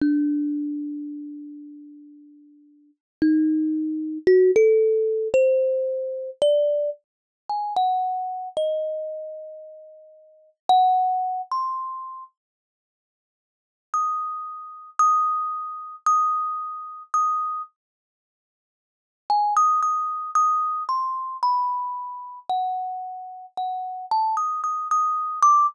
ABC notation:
X:1
M:6/4
L:1/16
Q:1/4=56
K:none
V:1 name="Kalimba"
D12 ^D4 ^F A3 c4 | d2 z2 ^g ^f3 ^d8 f3 c'3 z2 | z4 ^d'4 d'4 d'4 d'2 z6 | ^g ^d' d'2 d'2 c'2 b4 ^f4 f2 a d' d' d'2 =d' |]